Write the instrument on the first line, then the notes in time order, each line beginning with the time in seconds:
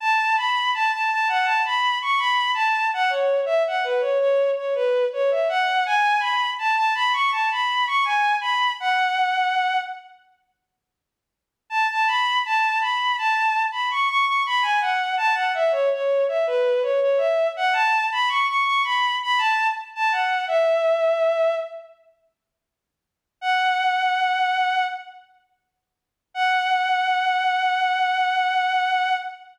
violin
0.00 A5
0.37 B5
0.74 A5
0.93 A5
1.11 A5
1.29 F#5
1.44 A5
1.65 B5
2.02 C#6
2.19 B5
2.54 A5
2.94 F#5
3.10 C#5
3.46 E5
3.67 F#5
3.84 B4
4.01 C#5
4.20 C#5
4.57 C#5
4.75 B4
5.13 C#5
5.31 E5
5.49 F#5
5.86 G#5
6.20 B5
6.59 A5
6.76 A5
6.95 B5
7.13 C#6
7.32 A5
7.51 B5
7.87 C#6
8.05 G#5
8.41 B5
8.80 F#5
11.70 A5
11.91 A5
12.07 B5
12.46 A5
12.81 B5
13.18 A5
13.72 B5
13.91 C#6
14.09 C#6
14.25 C#6
14.46 B5
14.62 G#5
14.81 F#5
15.17 A5
15.35 F#5
15.54 E5
15.72 C#5
15.93 C#5
16.28 E5
16.47 B4
16.82 C#5
17.01 C#5
17.18 E5
17.57 F#5
17.73 A5
18.12 B5
18.29 C#6
18.47 C#6
18.65 C#6
18.84 B5
19.23 B5
19.38 A5
19.95 A5
20.12 F#5
20.48 E5
23.41 F#5
26.34 F#5